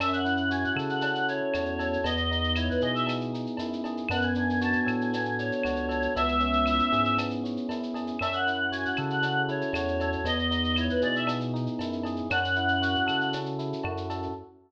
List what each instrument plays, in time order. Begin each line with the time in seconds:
0.00 synth bass 1 F#2, electric piano 1 C#4, choir aahs E5, cowbell, claves, shaker
0.13 choir aahs F#5, shaker
0.25 electric piano 1 E4, shaker
0.37 shaker
0.50 electric piano 1 F#4, choir aahs G#5, shaker
0.64 choir aahs F#5, shaker
0.76 synth bass 1 C#3, electric piano 1 A4, claves, shaker
0.89 choir aahs F#5, shaker
1.01 electric piano 1 C#4, cowbell, shaker
1.15 shaker
1.28 electric piano 1 E4, choir aahs C#5, shaker
1.54 synth bass 1 E2, electric piano 1 F#4, cowbell, claves, shaker
1.65 shaker
1.79 electric piano 1 A4, cowbell, shaker
1.93 shaker
2.04 synth bass 1 E2, electric piano 1 B3, choir aahs D#5, cowbell, shaker
2.17 shaker
2.31 electric piano 1 D#4, shaker
2.44 shaker
2.55 electric piano 1 E4, choir aahs C#5, claves, shaker
2.69 choir aahs B4, shaker
2.81 synth bass 1 B2, electric piano 1 G#4, choir aahs D#5, shaker
2.95 choir aahs E5, shaker
3.07 electric piano 1 B3, cowbell, claves, shaker
3.21 shaker
3.33 electric piano 1 D#4, shaker
3.46 shaker
3.57 synth bass 1 F#2, electric piano 1 E4, cowbell, shaker
3.73 shaker
3.84 electric piano 1 G#4, cowbell, shaker
3.97 shaker
4.09 synth bass 1 F#2, electric piano 1 B3, choir aahs F#5, cowbell, claves, shaker
4.21 choir aahs G#5, shaker
4.35 electric piano 1 D4, shaker
4.50 shaker
4.61 electric piano 1 F#4, choir aahs A5, shaker
4.73 choir aahs G#5, shaker
4.86 synth bass 1 A2, electric piano 1 A4, claves, shaker
5.00 choir aahs G#5, shaker
5.13 electric piano 1 B3, cowbell, shaker
5.25 shaker
5.38 electric piano 1 D4, choir aahs C#5, shaker
5.52 shaker
5.63 synth bass 1 C#2, electric piano 1 F#4, cowbell, claves, shaker
5.76 shaker
5.89 electric piano 1 A4, cowbell, shaker
6.02 shaker
6.15 synth bass 1 C#2, electric piano 1 B3, choir aahs E5, cowbell, shaker
6.28 shaker
6.40 electric piano 1 C#4, shaker
6.53 shaker
6.66 electric piano 1 E4, claves, shaker
6.79 shaker
6.92 synth bass 1 G#2, electric piano 1 G#4, shaker
7.05 shaker
7.18 electric piano 1 B3, cowbell, claves, shaker
7.30 shaker
7.43 electric piano 1 C#4, shaker
7.57 shaker
7.69 synth bass 1 F#2, electric piano 1 E4, cowbell, shaker
7.83 shaker
7.94 electric piano 1 G#4, cowbell, shaker
8.07 shaker
8.19 synth bass 1 F#2, electric piano 1 C#4, choir aahs E5, cowbell, claves, shaker
8.33 choir aahs F#5, shaker
8.47 electric piano 1 E4, shaker
8.72 electric piano 1 F#4, choir aahs G#5, shaker
8.85 choir aahs F#5, shaker
8.96 synth bass 1 C#3, electric piano 1 A4, claves, shaker
9.10 choir aahs F#5, shaker
9.22 electric piano 1 C#4, cowbell, shaker
9.49 electric piano 1 E4, choir aahs C#5, shaker
9.61 shaker
9.73 synth bass 1 E2, electric piano 1 F#4, cowbell, claves, shaker
9.88 shaker
10.00 electric piano 1 A4, cowbell, shaker
10.12 shaker
10.24 synth bass 1 E2, electric piano 1 B3, choir aahs D#5, cowbell, shaker
10.39 shaker
10.51 electric piano 1 D#4, shaker
10.64 shaker
10.76 electric piano 1 E4, choir aahs C#5, claves, shaker
10.90 choir aahs B4, shaker
11.01 synth bass 1 B2, electric piano 1 G#4, choir aahs D5, shaker
11.16 choir aahs E5, shaker
11.27 electric piano 1 B3, cowbell, claves, shaker
11.40 shaker
11.54 electric piano 1 D#4, shaker
11.66 shaker
11.79 synth bass 1 F#2, electric piano 1 E4, cowbell, shaker
11.92 shaker
12.03 electric piano 1 G#4, cowbell, shaker
12.16 shaker
12.30 synth bass 1 F#2, electric piano 1 C#4, choir aahs F#5, cowbell, claves, shaker
12.44 shaker
12.55 electric piano 1 E4, shaker
12.68 shaker
12.82 electric piano 1 F#4, shaker
12.95 shaker
13.06 synth bass 1 C#3, electric piano 1 A4, claves, shaker
13.21 shaker
13.33 electric piano 1 C#4, cowbell, shaker
13.46 shaker
13.59 electric piano 1 E4, shaker
13.73 shaker
13.84 synth bass 1 F#2, electric piano 1 F#4, cowbell, claves
13.97 shaker
14.10 electric piano 1 A4, cowbell, shaker
14.23 shaker